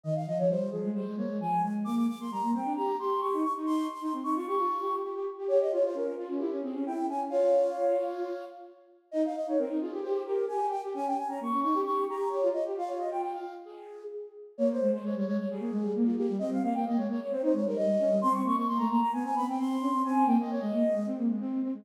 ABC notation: X:1
M:4/4
L:1/16
Q:1/4=132
K:Fm
V:1 name="Flute"
e f e d c2 A2 c2 d2 a2 a z | =d' d' d' c' b2 g2 b2 c'2 _d'2 d' z | c'2 c' c' z d' d' d'5 z4 | d e d c B2 F2 G2 A2 g2 a z |
[df]12 z4 | e f e d B2 A2 c2 B2 a2 g z | a g a b d'2 d'2 d'2 b2 d2 e z | f d e g g f2 z A4 z4 |
[K:Ab] d c2 c d d d d A4 z F G2 | e f f g e d d d c c d B e4 | c' d' d' d' c' b b b a a =b g c'4 | a2 g e d e5 z6 |]
V:2 name="Flute"
E,2 F, F, G,2 F, A, G, A, B, A, F,2 A,2 | B,2 z B, G, B, C =D G2 G2 G E z E | E2 z E C E F G F2 G2 G G z G | G2 F F D2 F D =E D C D E2 D2 |
F10 z6 | E2 z E C E F G G2 G2 G G z G | D2 z D B, D E G G2 G2 G F z G | F6 z10 |
[K:Ab] B,2 A, A, A, G, A, z G, B, A, G, B,2 B, G, | C2 B, B, B, A, B, z C E A, G, G,2 D G, | C2 B, B, B, =A, B, z =B, C B, C C2 D C | C2 B, B, B, A, B, z A, C B, A, C2 C A, |]